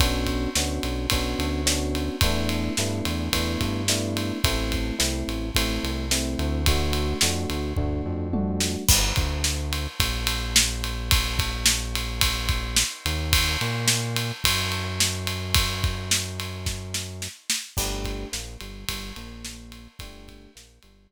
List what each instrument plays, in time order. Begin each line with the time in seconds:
0.00 synth bass 1 B1, electric piano 1 B3 C#4 D4 F#4, kick, ride
0.27 kick, ride
0.55 synth bass 1 D2, electric piano 1 B3 C#4 D4 F#4, snare
0.83 synth bass 1 B1, ride
1.10 synth bass 1 B1, electric piano 1 B3 C#4 D4 F#4, kick, ride
1.39 synth bass 1 D2, ride
1.66 electric piano 1 B3 C#4 D4 F#4, snare
1.95 ride
2.21 synth bass 1 E2, electric piano 1 A3 B3 D4 E4, kick, ride
2.49 ride
2.77 synth bass 1 G2, electric piano 1 A3 B3 D4 E4, snare
3.05 synth bass 1 E2, ride
3.33 synth bass 1 E2, electric piano 1 A3 B3 D4 E4, kick, ride
3.61 synth bass 1 G2, kick, ride
3.88 electric piano 1 A3 B3 D4 E4, snare
4.17 ride
4.44 synth bass 1 A1, electric piano 1 A3 C4 E4, kick, ride
4.72 kick, ride
4.99 synth bass 1 C2, electric piano 1 A3 C4 E4, snare
5.28 synth bass 1 A1, ride
5.55 synth bass 1 A1, electric piano 1 A3 C4 E4, kick, ride
5.83 synth bass 1 C2, ride
6.11 electric piano 1 A3 C4 E4, snare
6.39 synth bass 1 D2, ride
6.66 electric piano 1 A3 D4 F#4, kick, ride
6.93 ride
7.21 synth bass 1 F2, electric piano 1 A3 D4 F#4, snare
7.50 synth bass 1 D2, ride
7.77 synth bass 1 D2, electric piano 1 A3 D4 F#4, kick, floor tom
8.06 synth bass 1 F2
8.33 electric piano 1 A3 D4 F#4, high tom
8.60 snare
8.89 synth bass 1 G1, kick, crash
9.16 synth bass 1 D2, kick, ride
9.44 snare
9.73 ride
10.00 synth bass 1 A#1, kick, ride
10.27 ride
10.56 snare
10.84 ride
11.11 kick, ride
11.39 kick, ride
11.66 snare
11.95 ride
12.21 kick, ride
12.49 kick, ride
12.77 snare
13.05 synth bass 1 D#2, ride
13.33 kick, ride
13.61 synth bass 1 A#2, ride
13.88 snare
14.16 ride
14.44 synth bass 1 F#2, kick, ride
14.72 ride
15.00 snare
15.27 ride
15.55 kick, ride
15.84 kick, ride
16.11 snare
16.40 ride
16.66 kick, snare
16.94 snare
17.22 snare
17.50 snare
17.77 synth bass 1 G1, electric piano 1 A3 D4 G4, kick, crash
18.05 kick, ride
18.32 synth bass 1 A#1, electric piano 1 A#3, snare
18.61 synth bass 1 G1, electric piano 1 G3, ride
18.89 synth bass 1 G1, electric piano 1 G3, kick, ride
19.16 synth bass 1 A#1, electric piano 1 A#3, ride
19.45 snare
19.72 ride
19.99 synth bass 1 G1, electric piano 1 A3 D4 G4, kick, ride
20.28 kick, ride
20.55 synth bass 1 A#1, electric piano 1 A#3, snare
20.83 synth bass 1 G1, electric piano 1 G3, ride
21.10 electric piano 1 G3